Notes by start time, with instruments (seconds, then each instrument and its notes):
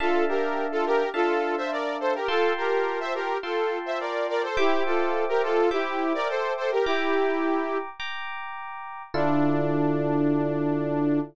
0.00 electric piano 1 D4 E5 F5 A5, lead 2 (sawtooth) F4 A4
0.29 lead 2 (sawtooth) G4 A#4
0.72 lead 2 (sawtooth) F4 A4
0.86 lead 2 (sawtooth) G4 A#4
1.14 electric piano 1 D4 E5 F5 A5, lead 2 (sawtooth) F4 A4
1.57 lead 2 (sawtooth) C5 E5
1.72 lead 2 (sawtooth) A#4 D5
2.00 lead 2 (sawtooth) A4 C5
2.14 lead 2 (sawtooth) G4 A#4
2.28 electric piano 1 F4 G5 A5 C6, lead 2 (sawtooth) F4 A4
2.57 lead 2 (sawtooth) G4 A#4
3.00 lead 2 (sawtooth) C5 E5
3.14 lead 2 (sawtooth) G4 A#4
3.43 lead 2 (sawtooth) F4 A4, electric piano 1 F4 G5 A5 C6
3.86 lead 2 (sawtooth) C5 E5
4.00 lead 2 (sawtooth) A#4 D5
4.29 lead 2 (sawtooth) A#4 D5
4.43 lead 2 (sawtooth) A4 C5
4.57 lead 2 (sawtooth) E4 G4, electric piano 1 C5 E5 G5 D6
4.86 lead 2 (sawtooth) F4 A4
5.29 lead 2 (sawtooth) G4 A#4
5.43 lead 2 (sawtooth) F4 A4
5.71 lead 2 (sawtooth) E4 G4, electric piano 1 C5 E5 G5 D6
6.14 lead 2 (sawtooth) A#4 D5
6.28 lead 2 (sawtooth) A4 C5
6.57 lead 2 (sawtooth) A4 C5
6.72 lead 2 (sawtooth) G4 A#4
6.85 lead 2 (sawtooth) E4 G4, electric piano 1 G5 A#5 D6
8.00 electric piano 1 G5 A#5 D6
9.14 electric piano 1 D3 E4 F4 A4, lead 2 (sawtooth) D4